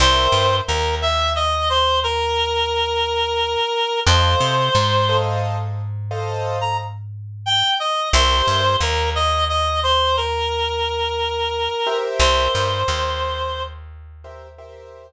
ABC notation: X:1
M:12/8
L:1/16
Q:3/8=59
K:C
V:1 name="Clarinet"
c4 _B2 e2 _e2 c2 B12 | c8 z7 _b z4 g2 _e2 | c4 _B2 _e2 e2 c2 B12 | c10 z14 |]
V:2 name="Acoustic Grand Piano"
[_Bceg]24 | [Ac_ef]6 [Acef]6 [Acef]12 | [G_Bce]22 [GBce]2- | [G_Bce]12 [GBce]2 [GBce]10 |]
V:3 name="Electric Bass (finger)" clef=bass
C,,2 G,,2 _E,,20 | F,,2 C,2 ^G,,20 | C,,2 G,,2 _E,,20 | C,,2 G,,2 _E,,20 |]